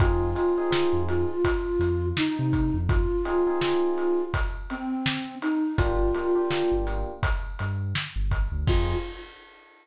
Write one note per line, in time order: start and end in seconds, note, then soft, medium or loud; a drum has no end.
0.00 0.35 F2 loud
0.00 0.30 C4 loud
0.00 0.30 D#4 loud
0.00 0.30 F4 loud
0.00 1.02 F4 medium
0.00 0.30 G#4 loud
0.00 kick loud
0.00 closed hi-hat loud
0.35 0.52 C4 medium
0.35 0.52 D#4 medium
0.35 0.52 F4 medium
0.35 0.52 G#4 medium
0.35 closed hi-hat medium
0.58 0.70 C4 medium
0.58 0.70 D#4 loud
0.58 0.70 F4 medium
0.58 0.70 G#4 loud
0.71 1.31 C4 medium
0.71 1.31 D#4 loud
0.71 1.31 F4 medium
0.71 1.31 G#4 loud
0.71 snare loud
0.93 1.25 F2 medium
1.08 2.06 F4 medium
1.08 closed hi-hat medium
1.45 kick medium
1.45 closed hi-hat loud
1.79 2.12 F2 medium
1.79 closed hi-hat medium
2.17 2.78 D#4 medium
2.17 snare loud
2.39 2.71 C3 medium
2.53 kick medium
2.53 closed hi-hat medium
2.74 3.06 F2 loud
2.89 4.22 F4 medium
2.89 kick loud
2.89 closed hi-hat medium
3.25 3.42 C4 medium
3.25 3.42 D#4 loud
3.25 3.42 F4 medium
3.25 3.42 G#4 loud
3.25 closed hi-hat medium
3.47 3.59 C4 medium
3.47 3.59 D#4 loud
3.47 3.59 F4 loud
3.47 3.59 G#4 loud
3.61 4.21 C4 medium
3.61 4.21 D#4 medium
3.61 4.21 F4 medium
3.61 4.21 G#4 loud
3.61 snare loud
3.98 closed hi-hat medium
4.34 kick medium
4.34 closed hi-hat loud
4.70 5.35 C4 medium
4.70 closed hi-hat medium
5.06 snare loud
5.42 5.77 D#4 medium
5.42 closed hi-hat medium
5.78 6.12 G1 medium
5.78 6.08 A#3 loud
5.78 6.08 D4 loud
5.78 6.74 F4 medium
5.78 6.08 F4 loud
5.78 6.08 G4 loud
5.78 kick loud
5.78 closed hi-hat loud
6.14 6.32 A#3 loud
6.14 6.32 D4 medium
6.14 6.32 F4 loud
6.14 6.32 G4 medium
6.14 closed hi-hat medium
6.35 6.48 A#3 medium
6.35 6.48 D4 medium
6.35 6.48 F4 medium
6.35 6.48 G4 medium
6.51 7.11 A#3 loud
6.51 7.11 D4 medium
6.51 7.11 F4 loud
6.51 7.11 G4 medium
6.51 snare loud
6.72 7.03 G1 medium
6.87 closed hi-hat medium
7.23 kick medium
7.23 closed hi-hat loud
7.59 7.93 G2 medium
7.59 closed hi-hat medium
7.95 snare loud
8.16 8.48 G1 medium
8.31 kick medium
8.31 closed hi-hat medium
8.52 8.65 D2 medium
8.67 8.95 F2 loud
8.67 8.94 C4 loud
8.67 8.94 D#4 loud
8.67 8.94 F4 loud
8.67 8.95 F4 loud
8.67 8.94 G#4 loud
8.67 kick loud
8.67 crash loud